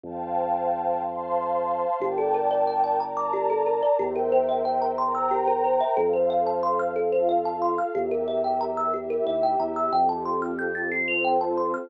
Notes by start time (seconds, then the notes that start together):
0.03 F2 C5 F5 G5 A5
1.02 C5 F5 A5 C6
2.00 G1 G4 A#4 D5 G5 A5
2.18 A4
2.34 A#4
2.51 D5
2.67 G5
2.84 A5
3.00 A#4 D5 A5 A#5
3.17 D6
3.33 G4
3.50 A4
3.66 A#4
3.83 D5
3.99 E2 G4 A#4 C5 E5 G5
4.16 A#4
4.32 C5
4.49 E5
4.65 G5
4.82 A#5
4.98 A#4 C5 G5 A#5 C6
5.15 E6
5.31 G4
5.48 A#4
5.64 C5
5.80 E5
5.97 F2 A4 C5 F5
6.13 C5
6.30 F5
6.47 A5
6.63 C6
6.79 F6
6.96 F4 A4 F5
7.12 C5
7.29 F5
7.45 A5
7.62 C6
7.78 F6
7.95 E2 G4 A#4 E5
8.11 A#4
8.28 E5
8.44 G5
8.61 A#5
8.77 E6
8.94 E4 G4 E5
9.10 A#4
9.26 D#2 E5
9.43 G5
9.60 E2 A#5
9.76 E6
9.92 F2 C4 F4 G4 A4 G5
10.09 A5
10.25 C6
10.42 F6
10.59 G6
10.75 A6
10.91 C4 F4 A4 C5 C7
11.08 F7
11.24 G5
11.41 A5
11.57 C6
11.74 F6